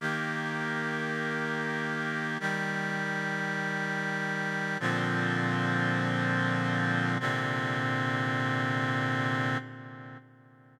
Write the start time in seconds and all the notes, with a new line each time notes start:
0.00 D#3 A#3 G4
2.40 D#3 G3 G4
4.80 A#2 D3 F3 C4
7.20 A#2 C3 D3 C4